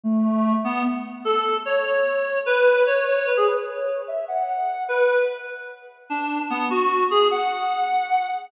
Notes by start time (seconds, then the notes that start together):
0.03 A3
0.64 B3
1.25 A4
1.65 C#5
1.85 C#5
2.46 B4
2.87 C#5
3.06 C#5
3.17 C#5
3.27 B4
3.37 G#4
3.47 B4
3.57 B4
3.67 C#5
4.08 E5
4.28 F#5
4.88 B4
6.10 D4
6.50 B3
6.70 F#4
7.11 G#4
7.31 F#5